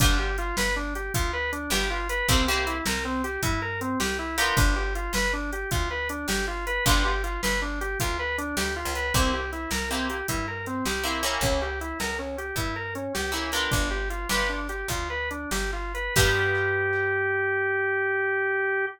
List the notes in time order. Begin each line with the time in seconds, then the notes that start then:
0.00 G1 B3 D4 F4 G4, kick, closed hi-hat
0.19 G4
0.38 F4, closed hi-hat
0.57 G1 B4, snare
0.76 D4
0.95 G4, closed hi-hat
1.14 D2 F4, kick, closed hi-hat
1.33 B4
1.52 D4, closed hi-hat
1.70 G1 B3 D4 F4 G4, snare
1.90 F4
2.09 B4, closed hi-hat
2.28 C2 A#3 C4 E4 G4, kick, closed hi-hat
2.48 A#3 C4 E4 G4
2.67 E4, closed hi-hat
2.86 C2 A#4, snare
3.05 C4
3.24 G4, closed hi-hat
3.43 G2 E4, kick, closed hi-hat
3.62 A#4
3.81 C4, closed hi-hat
4.00 C2 G4, snare
4.19 E4
4.38 B3 D4 F4 G4 A#4, open hi-hat
4.57 G1 D4, kick, closed hi-hat
4.76 G4
4.95 F4, closed hi-hat
5.13 G1 B4, snare
5.33 D4
5.53 G4, closed hi-hat
5.71 D2 F4, kick, closed hi-hat
5.91 B4
6.09 D4, closed hi-hat
6.28 G1 G4, snare
6.47 F4
6.67 B4, closed hi-hat
6.86 G1 B3 D4 F4 G4, kick, closed hi-hat
7.05 G4
7.24 F4, closed hi-hat
7.43 G1 B4, snare
7.62 D4
7.81 G4, closed hi-hat
8.00 D2 F4, kick, closed hi-hat
8.19 B4
8.38 D4, closed hi-hat
8.57 D2 G4, snare
8.76 F4
8.85 C#2
8.95 B4, closed hi-hat
9.14 C2 A#3 C4 E4 G4, kick, closed hi-hat
9.33 G4
9.52 E4, closed hi-hat
9.71 C2 A#4, snare
9.90 A#3 C4 E4 G4
10.09 G4, closed hi-hat
10.28 G2 E4, kick, closed hi-hat
10.48 A#4
10.66 C4, closed hi-hat
10.85 C2 G4, snare
11.03 A#3 C4 E4 G4
11.23 A#3 C#4 E4 G4 A#4, closed hi-hat
11.41 C#2 C#4, kick, closed hi-hat
11.62 G4
11.81 E4, closed hi-hat
12.00 C#2 A#4, snare
12.19 C#4
12.38 G4, closed hi-hat
12.56 G2 E4, kick, closed hi-hat
12.76 A#4
12.95 C#4, closed hi-hat
13.14 C#2 G4, snare
13.32 A#3 C#4 E4 G4
13.52 B3 D4 F4 G4 A#4, closed hi-hat
13.71 G1 D4, kick, closed hi-hat
13.91 G4
14.10 F4, closed hi-hat
14.29 G1 B3 D4 F4 G4 B4, snare
14.49 D4
14.69 G4, closed hi-hat
14.88 D2 F4, kick, closed hi-hat
15.10 B4
15.31 D4, closed hi-hat
15.51 G1 G4, snare
15.73 F4
15.94 B4, closed hi-hat
16.16 G2 B3 D4 F4 G4, kick, crash